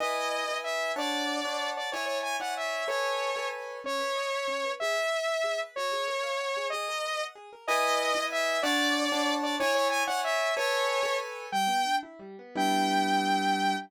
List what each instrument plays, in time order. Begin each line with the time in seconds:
0.00 acoustic grand piano E4 B4 D#5 G#5, lead 2 (sawtooth) D#5
0.49 acoustic grand piano E4 B4 D#5 G#5
0.64 lead 2 (sawtooth) E5
0.96 acoustic grand piano D4 C#5 F#5 A5, lead 2 (sawtooth) D5
1.45 acoustic grand piano D4 C#5 F#5 A5
1.77 lead 2 (sawtooth) D5
1.92 acoustic grand piano E4 C#5 D5 G#5, lead 2 (sawtooth) C#5
2.06 lead 2 (sawtooth) C#5
2.23 lead 2 (sawtooth) G#5
2.40 acoustic grand piano E4 C#5 D5 G#5, lead 2 (sawtooth) F#5
2.57 lead 2 (sawtooth) E5
2.88 acoustic grand piano A4 B4 C#5 G#5, lead 2 (sawtooth) C#5
3.36 acoustic grand piano A4 B4 C#5 G#5
3.84 acoustic grand piano C#4, lead 2 (sawtooth) C#5
3.99 acoustic grand piano B4
4.16 acoustic grand piano D#5
4.32 acoustic grand piano E5
4.48 acoustic grand piano C#4
4.64 acoustic grand piano B4
4.80 acoustic grand piano G#4, lead 2 (sawtooth) E5
4.95 acoustic grand piano B4
5.12 acoustic grand piano D#5
5.28 acoustic grand piano E5
5.44 acoustic grand piano G#4
5.60 acoustic grand piano B4
5.76 acoustic grand piano F#4, lead 2 (sawtooth) C#5
5.92 acoustic grand piano G#4
6.08 acoustic grand piano A#4
6.23 acoustic grand piano F5
6.40 acoustic grand piano F#4
6.57 acoustic grand piano G#4
6.70 acoustic grand piano G#4, lead 2 (sawtooth) D#5
6.88 acoustic grand piano A#4
7.05 acoustic grand piano B4
7.20 acoustic grand piano F#5
7.35 acoustic grand piano G#4
7.53 acoustic grand piano A#4
7.67 acoustic grand piano E4 B4 D#5 G#5, lead 2 (sawtooth) D#5
8.15 acoustic grand piano E4 B4 D#5 G#5
8.32 lead 2 (sawtooth) E5
8.63 acoustic grand piano D4 C#5 F#5 A5, lead 2 (sawtooth) D5
9.12 acoustic grand piano D4 C#5 F#5 A5
9.43 lead 2 (sawtooth) D5
9.60 acoustic grand piano E4 C#5 D5 G#5, lead 2 (sawtooth) C#5
9.75 lead 2 (sawtooth) C#5
9.90 lead 2 (sawtooth) G#5
10.07 acoustic grand piano E4 C#5 D5 G#5, lead 2 (sawtooth) F#5
10.24 lead 2 (sawtooth) E5
10.57 acoustic grand piano A4 B4 C#5 G#5, lead 2 (sawtooth) C#5
11.03 acoustic grand piano A4 B4 C#5 G#5
11.52 acoustic grand piano G3, lead 2 (sawtooth) G5
11.67 acoustic grand piano B3
11.85 acoustic grand piano D4
12.03 acoustic grand piano E4
12.19 acoustic grand piano G3
12.39 acoustic grand piano B3
12.55 acoustic grand piano G3 B3 D4 E4, lead 2 (sawtooth) G5